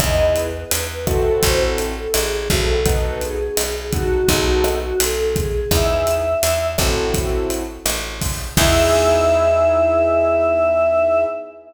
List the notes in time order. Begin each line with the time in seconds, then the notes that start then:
0.00 E2 B3 D#4 E4 G#4 D#5, kick, cross-stick, closed hi-hat
0.36 B4, closed hi-hat
0.71 E2, closed hi-hat
1.06 C4 E4 F#4 A4, kick, cross-stick, closed hi-hat
1.43 A1 C5, kick, closed hi-hat
1.60 A4
1.78 closed hi-hat
1.96 A4
2.14 A1 G#4, cross-stick, closed hi-hat
2.50 B1 C4 E4 F#4 A4, kick, closed hi-hat
2.84 B3 D#4 F#4 A4 B4, kick, closed hi-hat
3.21 G#4, closed hi-hat
3.57 B1, cross-stick, closed hi-hat
3.92 B3 D#4 F#4 A4, kick, closed hi-hat
4.28 B1 B3 D#4 F#4 G#4 A4, kick, closed hi-hat
4.46 F#4
4.64 cross-stick, closed hi-hat
4.81 F#4
4.98 B1 A4, closed hi-hat
5.35 G#4, kick, closed hi-hat
5.71 E2 B3 D#4 E4 G#4 E5, kick, cross-stick, closed hi-hat
6.07 closed hi-hat
6.43 E2, closed hi-hat
6.78 A1 C4 E4 F#4 A4, kick, cross-stick, closed hi-hat
7.14 kick, closed hi-hat
7.50 closed hi-hat
7.86 A1, cross-stick, closed hi-hat
8.21 kick, open hi-hat
8.56 E2 B3 D#4 E4 G#4 E5, kick, crash